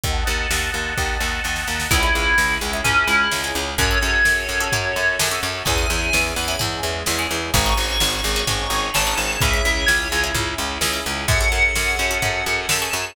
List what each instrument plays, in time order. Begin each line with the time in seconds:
0.04 electric bass (finger) D#2, string ensemble 1 D#5 F#5 A5, kick, closed hi-hat
0.27 electric bass (finger) D#2
0.51 electric bass (finger) D#2, snare
0.74 electric bass (finger) D#2
0.98 electric bass (finger) D#2, kick, snare
1.21 electric bass (finger) D#2, snare
1.44 electric bass (finger) D#2, snare
1.56 snare
1.68 electric bass (finger) D#2, snare
1.80 snare
1.91 electric bass (finger) C#2, string ensemble 1 C#4 E4 G#4, orchestral harp C#4 E4 G#4, tubular bells E4, kick, crash
2.03 orchestral harp C#4 E4 G#4
2.15 electric bass (finger) C#2
2.38 electric bass (finger) C#2, snare
2.61 electric bass (finger) C#2
2.73 orchestral harp C#4 E4 G#4
2.84 electric bass (finger) C#2, string ensemble 1 G#3 C#4 G#4, tubular bells C#4, orchestral harp C#4 E4 G#4, floor tom
3.07 electric bass (finger) C#2, tubular bells E4
3.31 electric bass (finger) C#2, orchestral harp C#4 E4 G#4, snare
3.44 orchestral harp C#4 E4 G#4
3.55 electric bass (finger) C#2
3.78 electric bass (finger) F#2, orchestral harp C#4 F#4 G#4 A4, string ensemble 1 C#4 F#4 G#4 A4, tubular bells C#5, kick, floor tom
3.91 orchestral harp C#4 F#4 G#4 A4
4.02 electric bass (finger) F#2
4.25 electric bass (finger) F#2, snare
4.49 electric bass (finger) F#2
4.60 orchestral harp C#4 F#4 G#4 A4
4.72 electric bass (finger) F#2, string ensemble 1 C#4 F#4 A4 C#5, orchestral harp C#4 F#4 G#4 A4, floor tom
4.96 electric bass (finger) F#2
5.19 electric bass (finger) F#2, orchestral harp C#4 F#4 G#4 A4, snare
5.31 orchestral harp C#4 F#4 G#4 A4
5.43 electric bass (finger) F#2
5.65 electric bass (finger) E2, string ensemble 1 C#4 E4 G#4, orchestral harp C#4 E4 G#4, tubular bells G#5, kick, floor tom
5.78 orchestral harp C#4 E4 G#4
5.90 electric bass (finger) E2
6.13 electric bass (finger) E2, snare
6.36 electric bass (finger) E2, tubular bells B5
6.48 orchestral harp C#4 E4 G#4
6.59 electric bass (finger) E2, string ensemble 1 G#3 C#4 G#4, orchestral harp C#4 E4 G#4, floor tom
6.83 electric bass (finger) E2
7.06 electric bass (finger) E2, orchestral harp C#4 E4 G#4, snare
7.19 orchestral harp C#4 E4 G#4
7.31 electric bass (finger) E2
7.53 electric bass (finger) G#1, string ensemble 1 C#4 D#4 F#4 G#4, orchestral harp C#4 D#4 F#4 G#4, tubular bells C#6, kick, floor tom
7.66 orchestral harp C#4 D#4 F#4 G#4
7.77 electric bass (finger) G#1
8.00 electric bass (finger) G#1, snare
8.24 electric bass (finger) G#1
8.36 orchestral harp C#4 D#4 F#4 G#4
8.47 electric bass (finger) G#1, orchestral harp C#4 D#4 F#4 G#4, string ensemble 1 C#4 D#4 G#4 C#5, floor tom
8.70 electric bass (finger) G#1
8.94 electric bass (finger) G#1, orchestral harp C#4 D#4 F#4 G#4, tubular bells A5, snare
9.07 orchestral harp C#4 D#4 F#4 G#4
9.17 electric bass (finger) G#1
9.41 electric bass (finger) C#2, string ensemble 1 C#4 E4 G#4, orchestral harp C#4 E4 G#4, tubular bells E5, kick, floor tom
9.53 orchestral harp C#4 E4 G#4
9.65 electric bass (finger) C#2
9.86 electric bass (finger) C#2, tubular bells C#5, snare
10.12 electric bass (finger) C#2
10.24 orchestral harp C#4 E4 G#4
10.34 electric bass (finger) C#2, orchestral harp C#4 E4 G#4, floor tom
10.58 electric bass (finger) C#2
10.81 electric bass (finger) C#2, orchestral harp C#4 E4 G#4, snare
10.93 orchestral harp C#4 E4 G#4
11.06 electric bass (finger) C#2
11.28 electric bass (finger) F#2, orchestral harp C#4 F#4 G#4 A4, string ensemble 1 C#4 F#4 G#4 A4, tubular bells F#5, kick, floor tom
11.41 orchestral harp C#4 F#4 G#4 A4
11.52 electric bass (finger) F#2
11.75 electric bass (finger) F#2, snare
11.99 electric bass (finger) F#2
12.11 orchestral harp C#4 F#4 G#4 A4
12.22 electric bass (finger) F#2, orchestral harp C#4 F#4 G#4 A4, floor tom
12.46 electric bass (finger) F#2
12.69 electric bass (finger) F#2, orchestral harp C#4 F#4 G#4 A4, tubular bells A5, snare
12.82 orchestral harp C#4 F#4 G#4 A4
12.93 electric bass (finger) F#2